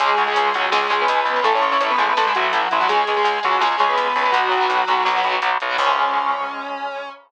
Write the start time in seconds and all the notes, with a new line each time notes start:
0.00 C#2 G#3 C#4 G#4, kick, closed hi-hat
0.18 C#2, closed hi-hat
0.27 G#3 C#4 G#4
0.36 C#2, closed hi-hat
0.54 C#2 F#3 G#3 C#4 F#4, kick, closed hi-hat
0.72 C#2 G#3 C#4 G#4, snare
0.83 G#3 C#4
0.90 C#2 G#3 C#4 G#4, closed hi-hat
1.01 B3 B4
1.08 C#2, closed hi-hat
1.25 C#2, closed hi-hat
1.36 G#3 C#4
1.44 A1 A3 E4 A4, kick, closed hi-hat
1.55 C#4 C#5
1.62 A1, closed hi-hat
1.72 A3 C#4 E4 C#5
1.80 A1 C#4 C#5, closed hi-hat
1.90 B3 B4
1.98 A1 G#3 A3 E4 G#4, kick, closed hi-hat
2.08 B3 B4
2.17 A1 A3 E4 A4, snare
2.26 G#3 A3 E4 G#4
2.33 A1 F#3 A3 E4 F#4, kick, closed hi-hat
2.53 A1 E3 E4, closed hi-hat
2.62 F#3 F#4
2.71 A1 E3 E4, closed hi-hat
2.80 F#3 A3 E4 F#4
2.88 C#2 G#3 C#4 G#4, kick, closed hi-hat
3.07 C#2, closed hi-hat
3.16 G#3 C#4 G#4
3.24 C#2, closed hi-hat
3.43 C#2 F#3 G#3 C#4 F#4, closed hi-hat
3.60 C#2 G#3 C#4 G#4, snare
3.72 G#3 C#4
3.78 C#2 G#3 C#4 G#4, closed hi-hat
3.89 B3 B4
3.98 C#2, closed hi-hat
4.16 C#2, open hi-hat
4.25 G#3 C#4
4.32 B1 F#3 B3 F#4, kick, closed hi-hat
4.51 B1, closed hi-hat
4.60 F#3 B3
4.69 B1, closed hi-hat
4.87 B1 F#3 B3, closed hi-hat
5.05 B1 F#3 B3, snare
5.16 F#3 B3
5.24 B1 F#3 B3, closed hi-hat
5.42 B1, closed hi-hat
5.60 B1, closed hi-hat
5.69 F#3 B3
5.78 C#2 G#3 C#4, kick, crash